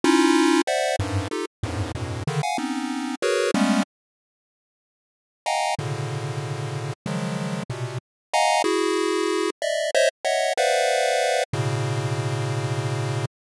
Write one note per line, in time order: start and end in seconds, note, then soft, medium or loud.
0.04 0.62 C#4 loud
0.04 0.62 D#4 loud
0.04 0.62 E4 loud
0.04 0.62 F4 loud
0.67 0.96 C5 medium
0.67 0.96 D5 medium
0.67 0.96 E5 medium
0.67 0.96 F#5 medium
0.99 1.28 F#2 medium
0.99 1.28 G2 medium
0.99 1.28 G#2 medium
1.31 1.45 D#4 medium
1.31 1.45 F4 medium
1.31 1.45 G4 medium
1.31 1.45 A4 medium
1.63 1.92 E2 medium
1.63 1.92 F#2 medium
1.63 1.92 G2 medium
1.63 1.92 G#2 medium
1.63 1.92 A2 medium
1.95 2.24 F2 medium
1.95 2.24 G2 medium
1.95 2.24 A2 medium
1.95 2.24 B2 medium
2.27 2.42 C#3 medium
2.27 2.42 D3 medium
2.27 2.42 D#3 medium
2.43 2.57 F5 medium
2.43 2.57 F#5 medium
2.43 2.57 G#5 medium
2.58 3.15 B3 medium
2.58 3.15 C4 medium
2.58 3.15 C#4 medium
2.58 3.15 D#4 medium
3.22 3.51 F#4 medium
3.22 3.51 G#4 medium
3.22 3.51 A#4 medium
3.22 3.51 B4 medium
3.22 3.51 C#5 medium
3.54 3.83 G3 medium
3.54 3.83 G#3 medium
3.54 3.83 A3 medium
3.54 3.83 B3 medium
3.54 3.83 C#4 medium
5.46 5.75 D#5 medium
5.46 5.75 F5 medium
5.46 5.75 F#5 medium
5.46 5.75 G5 medium
5.46 5.75 G#5 medium
5.46 5.75 A#5 medium
5.79 6.93 A2 medium
5.79 6.93 B2 medium
5.79 6.93 C#3 medium
5.79 6.93 D3 medium
7.06 7.63 C#3 medium
7.06 7.63 D#3 medium
7.06 7.63 F3 medium
7.06 7.63 F#3 medium
7.06 7.63 G#3 medium
7.70 7.98 A#2 medium
7.70 7.98 B2 medium
7.70 7.98 C3 medium
8.34 8.62 D#5 medium
8.34 8.62 F5 medium
8.34 8.62 F#5 medium
8.34 8.62 G#5 medium
8.34 8.62 A#5 medium
8.64 9.50 E4 medium
8.64 9.50 F#4 medium
8.64 9.50 G#4 medium
9.62 9.91 D5 medium
9.62 9.91 D#5 medium
9.62 9.91 E5 medium
9.95 10.09 C5 loud
9.95 10.09 C#5 loud
9.95 10.09 D#5 loud
9.95 10.09 E5 loud
10.24 10.53 C#5 medium
10.24 10.53 D#5 medium
10.24 10.53 E5 medium
10.24 10.53 F#5 medium
10.57 11.44 B4 medium
10.57 11.44 C5 medium
10.57 11.44 D5 medium
10.57 11.44 E5 medium
10.57 11.44 F5 medium
10.57 11.44 F#5 medium
11.53 13.25 A2 medium
11.53 13.25 B2 medium
11.53 13.25 C#3 medium